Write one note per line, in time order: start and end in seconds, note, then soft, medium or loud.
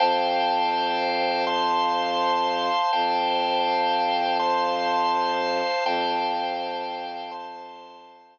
0.00 2.69 F2 medium
0.00 1.45 C5 loud
0.00 1.45 F5 loud
0.00 1.45 G5 loud
0.00 1.45 A5 loud
1.47 2.91 C5 medium
1.47 2.91 F5 loud
1.47 2.91 A5 medium
1.47 2.91 C6 loud
2.93 5.62 F2 medium
2.93 4.37 C5 loud
2.93 4.37 F5 loud
2.93 4.37 G5 medium
2.93 4.37 A5 medium
4.39 5.84 C5 loud
4.39 5.84 F5 loud
4.39 5.84 A5 medium
4.39 5.84 C6 loud
5.85 8.38 F2 medium
5.85 7.31 C5 loud
5.85 7.31 F5 loud
5.85 7.31 G5 loud
5.85 7.31 A5 medium
7.31 8.38 C5 loud
7.31 8.38 F5 medium
7.31 8.38 A5 loud
7.31 8.38 C6 medium